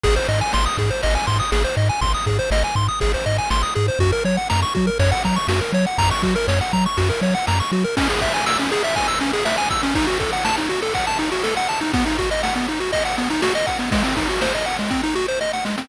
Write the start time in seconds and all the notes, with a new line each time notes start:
0.04 G#1 G#4, kick, crash
0.16 C5
0.29 G#2 D#5
0.41 G#5
0.53 G#1 C6, snare
0.66 D#6
0.78 G#2 G#4, kick
0.90 C5
1.03 G#1 D#5, kick, ride
1.15 G#5
1.27 G#2 C6, kick
1.40 D#6
1.52 G#1 G#4, snare
1.64 C5
1.77 G#2 D#5
1.89 G#5
2.01 G#1 C6, kick, ride
2.14 D#6
2.26 G#2 G#4, kick
2.39 C5
2.51 G#1 D#5, snare
2.64 G#5
2.75 G#2 C6, kick
2.88 D#6
3.00 G#1 G#4, kick, ride
3.14 C5
3.26 G#2 D#5
3.38 G#5
3.50 G#1 C6, snare
3.63 D#6
3.75 G#2 G#4
3.88 C5
3.99 F#2 F#4, kick, ride
4.12 A#4
4.25 F#3 C#5
4.37 F#5
4.50 F#2 A#5, snare
4.62 C#6
4.75 F#3 F#4, kick
4.87 A#4
4.99 F#2 C#5, kick, ride
5.12 F#5
5.24 F#3 A#5, kick
5.36 C#6
5.48 F#2 F#4, snare
5.61 A#4
5.73 F#3 C#5
5.87 F#5
5.98 F#2 A#5, kick, ride
6.11 C#6
6.22 F#3 F#4, kick
6.36 A#4
6.48 F#2 C#5, snare
6.61 F#5
6.73 F#3 A#5, kick
6.86 C#6
6.97 F#2 F#4, kick, ride
7.10 A#4
7.21 F#3 C#5
7.35 F#5
7.47 F#2 A#5, snare
7.60 C#6
7.72 F#3 F#4
7.84 A#4
7.97 C#4, kick, crash
8.09 G#4, ride
8.21 E5, kick, ride
8.33 G#5, ride
8.46 E6, snare
8.59 C#4, ride
8.71 G#4, ride
8.83 E5, ride
8.96 G#5, kick, ride
9.08 E6, ride
9.21 C#4, ride
9.33 G#4, ride
9.45 E5, snare
9.58 G#5, ride
9.70 E6, kick, snare, ride
9.83 C#4, ride
9.95 D#4, kick, ride
10.07 F#4, ride
10.20 A4, kick, ride
10.33 F#5, ride
10.45 A5, snare
10.58 D#4, ride
10.69 F#4, ride
10.82 A4, ride
10.94 F#5, kick, ride
11.07 A5, ride
11.19 D#4, ride
11.32 F#4, ride
11.43 A4, snare
11.56 F#5, ride
11.68 A5, snare, ride
11.81 D#4, ride
11.93 B3, kick, ride
12.06 D#4, ride
12.18 F#4, kick, ride
12.31 D#5, ride
12.43 F#5, snare
12.56 B3, ride
12.68 D#4, ride
12.80 F#4, ride
12.93 D#5, kick, ride
13.05 F#5, ride
13.17 B3, ride
13.30 D#4, ride
13.42 F#4, snare
13.55 D#5, ride
13.67 F#5, kick, snare, ride
13.79 B3, ride
13.92 G#3, kick, ride
14.04 C4, ride
14.17 D#4, kick, ride
14.29 F#4, ride
14.41 C5, snare
14.54 D#5, ride
14.66 F#5, ride
14.79 G#3, ride
14.90 C4, kick, snare
15.03 D#4
15.15 F#4, snare
15.28 C5
15.41 D#5, snare
15.53 F#5, snare
15.65 G#3, snare
15.78 C4, snare